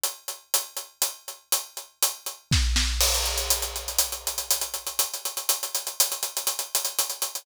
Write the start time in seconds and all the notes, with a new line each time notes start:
0.04 closed hi-hat
0.28 closed hi-hat
0.54 closed hi-hat
0.77 closed hi-hat
1.02 closed hi-hat
1.28 closed hi-hat
1.52 closed hi-hat
1.77 closed hi-hat
2.02 closed hi-hat
2.26 closed hi-hat
2.51 kick, snare
2.76 snare
3.01 crash
3.14 closed hi-hat
3.25 closed hi-hat
3.38 closed hi-hat
3.50 closed hi-hat
3.62 closed hi-hat
3.76 closed hi-hat
3.88 closed hi-hat
3.98 closed hi-hat
4.12 closed hi-hat
4.27 closed hi-hat
4.38 closed hi-hat
4.51 closed hi-hat
4.61 closed hi-hat
4.74 closed hi-hat
4.87 closed hi-hat
4.99 closed hi-hat
5.14 closed hi-hat
5.25 closed hi-hat
5.37 closed hi-hat
5.49 closed hi-hat
5.63 closed hi-hat
5.75 closed hi-hat
5.87 closed hi-hat
6.00 closed hi-hat
6.12 closed hi-hat
6.23 closed hi-hat
6.37 closed hi-hat
6.47 closed hi-hat
6.59 closed hi-hat
6.75 closed hi-hat
6.85 closed hi-hat
6.99 closed hi-hat
7.10 closed hi-hat
7.22 closed hi-hat
7.35 closed hi-hat